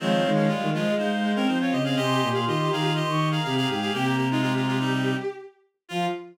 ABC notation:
X:1
M:4/4
L:1/16
Q:1/4=122
K:Fm
V:1 name="Ocarina"
[df]4 f2 e2 f f2 g2 f e e | [ac']4 c'2 b2 c' d'2 b2 b g a | g b9 z6 | f4 z12 |]
V:2 name="Clarinet"
[E,C]3 [F,D] [A,F]2 [A,F]2 [Ec]3 [DB] [Ec] [Fd] [Ge] [Af] | [Ge]3 [Af] [Ge]2 [Af]2 [Ge]3 [Af] [Af] [Af] [Af] [Af] | [B,G]2 [B,G] [A,F] [A,F] [A,F] [A,F] [G,E]3 z6 | F4 z12 |]
V:3 name="Violin"
A, z A,2 G, E, F, A, A, z A, C4 C | G G G G F G G F z4 G4 | G2 z E G8 z4 | F4 z12 |]
V:4 name="Violin" clef=bass
F,2 E, E, A,2 A,3 A,3 F,2 D,2 | C,2 B,, B,, E,2 E,3 E,3 C,2 A,,2 | C,10 z6 | F,4 z12 |]